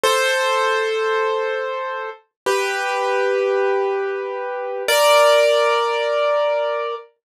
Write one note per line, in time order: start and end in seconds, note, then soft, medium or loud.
0.04 2.10 A4 medium
0.04 2.10 C5 loud
2.46 4.83 G4 medium
2.46 4.83 B4 medium
4.88 6.95 A#4 loud
4.88 6.95 D5 loud